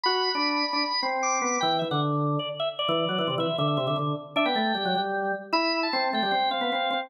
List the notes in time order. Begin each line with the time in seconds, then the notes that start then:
0.04 F#4 B5
0.35 D4
0.73 D4
1.03 C4
1.23 D6
1.42 B3
1.61 E3 G5
1.79 E3 E5
1.91 D3 F#5
2.39 D5
2.60 E5
2.79 D5
2.89 E3
3.09 F#3
3.18 E3
3.28 C3
3.38 E3 E5
3.58 D3 E5
3.68 E5
3.77 C3 E5
3.87 D3 E5
3.96 D3
4.36 D4 E5
4.46 B3 G5
4.55 A3
4.75 G3
4.85 F#3
4.95 G3
5.53 E4 B5
5.83 A5
5.93 C4
6.13 A3 G5
6.23 G3
6.31 C4 G5
6.51 C4 F5
6.61 B3
6.72 C4
6.91 C4